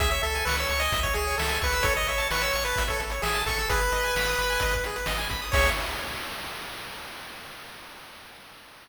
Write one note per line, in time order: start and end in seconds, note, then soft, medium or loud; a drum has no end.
0.00 0.20 C#2 medium
0.00 0.10 G#4 loud
0.00 0.09 E5 loud
0.00 kick loud
0.00 closed hi-hat loud
0.10 0.22 C#5 medium
0.10 0.22 E5 loud
0.10 closed hi-hat medium
0.23 0.43 C#2 medium
0.23 0.45 A4 loud
0.23 0.34 E5 medium
0.23 closed hi-hat medium
0.35 0.45 G#5 medium
0.35 closed hi-hat medium
0.45 0.66 C#2 medium
0.45 0.56 B4 loud
0.45 0.57 C#6 medium
0.45 snare loud
0.57 0.82 C#5 medium
0.57 0.68 E6 medium
0.57 closed hi-hat medium
0.69 0.89 C#2 medium
0.69 0.80 C#6 medium
0.69 closed hi-hat medium
0.79 1.00 D#5 loud
0.79 0.92 G#5 medium
0.79 closed hi-hat medium
0.92 1.12 C#2 medium
0.92 1.04 E5 medium
0.92 kick loud
0.92 closed hi-hat loud
1.03 1.14 C#5 loud
1.03 1.14 C#5 medium
1.03 kick medium
1.03 closed hi-hat medium
1.14 1.35 C#2 medium
1.14 1.24 G#4 medium
1.14 1.36 G#4 loud
1.14 closed hi-hat medium
1.27 1.38 C#5 medium
1.27 closed hi-hat medium
1.38 1.58 C#2 medium
1.38 1.59 A4 loud
1.38 1.50 E5 medium
1.38 snare loud
1.49 1.60 G#5 medium
1.49 closed hi-hat medium
1.62 1.81 C#2 medium
1.62 1.86 B4 loud
1.62 1.72 C#6 medium
1.62 kick medium
1.62 closed hi-hat medium
1.73 1.83 E6 medium
1.73 closed hi-hat medium
1.83 2.04 A1 medium
1.83 1.95 A4 loud
1.83 1.94 C#5 loud
1.83 kick loud
1.83 closed hi-hat loud
1.95 2.06 C#5 medium
1.95 2.07 D#5 loud
1.95 closed hi-hat medium
2.07 2.27 A1 medium
2.07 2.28 C#5 loud
2.07 2.19 E5 medium
2.07 closed hi-hat medium
2.18 2.28 A5 medium
2.18 closed hi-hat medium
2.31 2.50 A1 medium
2.31 2.42 B4 loud
2.31 2.42 C#6 medium
2.31 snare loud
2.42 2.64 C#5 loud
2.42 2.52 E6 medium
2.42 closed hi-hat medium
2.53 2.73 A1 medium
2.53 2.63 C#6 medium
2.53 closed hi-hat medium
2.65 2.84 B4 loud
2.65 2.75 A5 medium
2.65 closed hi-hat medium
2.76 2.97 A1 medium
2.76 2.88 E5 medium
2.76 kick medium
2.76 closed hi-hat loud
2.87 3.01 A4 medium
2.87 2.98 C#5 medium
2.87 kick medium
2.87 closed hi-hat medium
3.00 3.20 A1 medium
3.00 3.11 A4 medium
3.00 closed hi-hat medium
3.10 3.22 C#5 medium
3.10 closed hi-hat medium
3.22 3.43 A1 medium
3.22 3.42 G#4 loud
3.22 3.33 E5 medium
3.22 snare loud
3.34 3.45 A5 medium
3.34 closed hi-hat medium
3.46 3.66 A1 medium
3.46 3.69 A4 loud
3.46 3.57 C#6 medium
3.46 kick medium
3.46 closed hi-hat medium
3.58 3.69 E6 medium
3.58 closed hi-hat medium
3.69 3.89 G#1 medium
3.69 3.80 G#4 loud
3.69 4.74 B4 loud
3.69 kick loud
3.69 closed hi-hat loud
3.79 3.91 B4 medium
3.79 closed hi-hat medium
3.92 4.12 G#1 medium
3.92 4.03 D#5 medium
3.92 closed hi-hat medium
4.03 4.15 G#5 medium
4.03 closed hi-hat medium
4.15 4.35 G#1 medium
4.15 4.27 B5 medium
4.15 snare loud
4.26 4.38 D#6 medium
4.26 closed hi-hat medium
4.38 4.58 G#1 medium
4.38 4.49 B5 medium
4.38 closed hi-hat medium
4.50 4.60 G#5 medium
4.50 closed hi-hat medium
4.60 4.81 G#1 medium
4.60 4.73 D#5 medium
4.60 kick medium
4.60 closed hi-hat loud
4.71 4.84 B4 medium
4.71 kick medium
4.71 closed hi-hat medium
4.84 5.04 G#1 medium
4.84 4.96 G#4 medium
4.84 closed hi-hat medium
4.96 5.06 B4 medium
4.96 closed hi-hat medium
5.06 5.27 G#1 medium
5.06 5.17 D#5 medium
5.06 snare loud
5.18 5.28 G#5 medium
5.18 closed hi-hat medium
5.29 5.50 G#1 medium
5.29 5.41 B5 medium
5.29 kick medium
5.29 closed hi-hat medium
5.42 5.52 D#6 medium
5.42 closed hi-hat medium
5.52 5.70 C#2 loud
5.52 5.70 G#4 medium
5.52 5.68 C#5 loud
5.52 5.70 C#5 loud
5.52 5.70 E5 loud
5.52 kick loud
5.52 crash loud